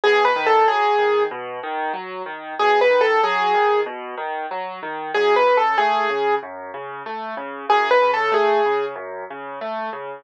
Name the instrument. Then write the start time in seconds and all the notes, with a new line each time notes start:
acoustic grand piano
0.04 B2 G#4
0.25 B4
0.36 D#3
0.46 A4
0.67 F#3 G#4
0.98 D#3
1.31 B2
1.63 D#3
1.93 F#3
2.26 D#3
2.59 B2 G#4
2.81 B4
2.90 D#3
3.01 A4
3.23 F#3 G#4
3.54 D#3
3.86 B2
4.18 D#3
4.51 F#3
4.83 D#3
5.14 F#2 G#4
5.36 B4
5.46 C#3
5.57 A4
5.78 A3 G#4
6.10 C#3
6.43 F#2
6.74 C#3
7.06 A3
7.37 C#3
7.69 F#2 G#4
7.91 B4
8.02 C#3
8.14 A4
8.32 A3 G#4
8.66 C#3
8.96 F#2
9.30 C#3
9.61 A3
9.93 C#3